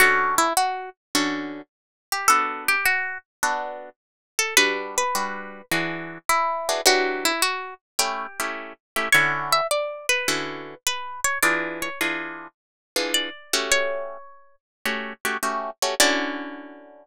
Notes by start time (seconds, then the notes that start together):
0.00 D3 C#4 F#4 A4
0.38 E4
0.57 F#4
1.15 D3 C#4 F#4 A4
2.12 G4
2.28 B3 D4 F#4 A4
2.68 G4
2.85 F#4
3.43 B3 D4 F#4 A4
4.39 A4
4.57 G3 D4 F#4 B4
4.98 B4
5.15 G3 D4 F#4 B4
5.71 E3 D4 F#4 G#4
6.29 E4
6.69 E3 D4 F#4 G#4
6.86 E3 F#3 D4 F#4 G4
7.25 E4
7.42 F#4
7.99 A3 C#4 E4 G4
8.40 A3 C#4 E4 G4
8.96 A3 C#4 E4 G4
9.12 D3 C#4 E4 F#4 C#5
9.53 E5
9.71 D5
10.09 B4
10.28 D3 C#4 E4 F#4
10.87 B4
11.24 C#5
11.43 E3 D4 F4 G#4 D5
11.82 C#5
12.01 E3 D4 F4 G#4
12.96 E3 D4 F4 G#4
13.14 D5
13.53 A3 C#4 F#4 G4
13.72 C#5
14.85 A3 C#4 F#4 G4
15.25 A3 C#4 F#4 G4
15.43 A3 C#4 F#4 G4
15.82 A3 C#4 F#4 G4
16.00 D3 C#4 E4 F#4 D5